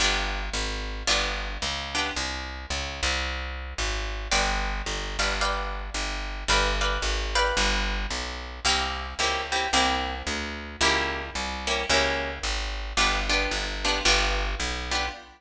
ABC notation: X:1
M:4/4
L:1/8
Q:"Swing" 1/4=111
K:G
V:1 name="Acoustic Guitar (steel)"
[B,D=FG]4 [B,DFG]3 [B,DFG] | z8 | [Bd=fg]3 [Bdfg] [Bdfg]4 | [Bd=fg] [Bdfg]2 [Bdfg]5 |
[_B,CEG]2 [B,CEG] [B,CEG] [B,CEG]4 | [_B,^CEG]3 [B,CEG] [B,CEG]4 | [B,D=FG] [B,DFG]2 [B,DFG] [B,DFG]3 [B,DFG] |]
V:2 name="Electric Bass (finger)" clef=bass
G,,,2 ^G,,,2 =G,,,2 ^C,,2 | C,,2 ^C,, =C,,3 ^G,,,2 | G,,,2 G,,, G,,,3 G,,,2 | G,,,2 ^G,,,2 =G,,,2 B,,,2 |
C,,2 ^C,,2 =C,,2 D,,2 | ^C,,2 =C,,2 ^C,,2 ^G,,,2 | G,,,2 G,,,2 G,,,2 B,,,2 |]